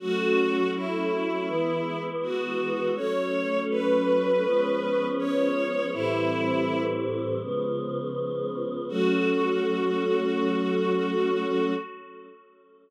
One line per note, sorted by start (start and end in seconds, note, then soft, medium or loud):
0.00 1.47 F#3 medium
0.00 1.47 A3 medium
0.00 1.47 C#4 medium
0.00 0.71 F#4 loud
0.74 2.03 E4 medium
1.48 2.95 E3 loud
1.48 2.95 G#3 medium
1.48 2.95 B3 medium
2.22 2.91 F#4 medium
2.96 4.43 F#3 medium
2.96 4.43 A3 medium
2.96 4.43 C#4 medium
2.96 3.60 C#5 loud
3.70 5.07 B4 medium
4.44 5.91 F3 medium
4.44 5.91 G#3 medium
4.44 5.91 B3 medium
4.44 5.91 C#4 medium
5.18 5.90 C#5 loud
5.92 7.39 A2 medium
5.92 7.39 E3 medium
5.92 7.39 G3 medium
5.92 7.39 C4 medium
5.92 6.82 E4 loud
7.41 8.87 C#3 medium
7.41 8.87 F3 medium
7.41 8.87 G#3 medium
7.41 8.87 B3 medium
8.89 11.72 F#3 loud
8.89 11.72 A3 loud
8.89 11.72 C#4 medium
8.89 11.72 F#4 loud